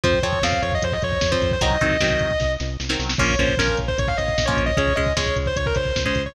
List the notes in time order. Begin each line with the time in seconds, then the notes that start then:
0.04 F2 F3 C4 C5, kick, closed hi-hat
0.13 kick
0.23 F2 F3 C4 C#5, kick, closed hi-hat
0.33 kick
0.42 F2 F3 C4 F5, kick, snare
0.52 kick
0.62 F2 C#5, kick, closed hi-hat
0.72 D#5, kick
0.82 F2 C5, kick, closed hi-hat
0.92 D#5, kick
1.02 F2 C#5, kick, closed hi-hat
1.12 kick
1.21 F2, kick, snare
1.31 F3 C4 C5, kick
1.42 F2, kick, closed hi-hat
1.51 C5, kick
1.61 C2 D#3 F#3 C4 D#5, kick, closed hi-hat
1.70 kick
1.81 C2 D#3 F#3 C4, kick, closed hi-hat
1.91 kick
2.00 C2 D#3 F#3 C4, kick, snare
2.10 kick
2.19 C2, kick, closed hi-hat
2.31 kick
2.40 C2, kick, snare
2.60 C2, snare
2.80 C2, snare
2.89 D#3 F#3 C4, snare
2.99 C2, snare
3.09 snare
3.18 A#1 F3 A#3 C#4 C#5, kick, crash
3.30 kick
3.38 A#1 F3 A#3 C#4 C5, kick, closed hi-hat
3.48 kick
3.57 A#1 F3 A#3 C#4 A#4, kick, snare
3.68 kick
3.77 A#1, kick, closed hi-hat
3.88 C5, kick
3.98 A#1 C#5, kick, closed hi-hat
4.08 F5, kick
4.18 A#1 D#5, kick, closed hi-hat
4.28 kick
4.38 A#1, kick, snare
4.46 F3 A#3 C#4 C#5, kick
4.57 A#1, kick, closed hi-hat
4.66 D#5, kick
4.77 C#2 G#3 C#4 C#5, kick, closed hi-hat
4.88 kick
4.95 C#2 G#3 C#4 D#5, kick
5.06 kick
5.16 C#2 G#3 C#4 C#5, kick, snare, closed hi-hat
5.26 kick
5.36 C#2, kick, closed hi-hat
5.46 C5, kick
5.56 C#2 C#5, kick, closed hi-hat
5.66 A#4, kick
5.75 C#2 C5, kick, closed hi-hat
5.86 kick
5.96 C#2, kick, snare
6.05 G#3 C#4 C5, kick
6.15 C#2, kick, closed hi-hat
6.26 C#5, kick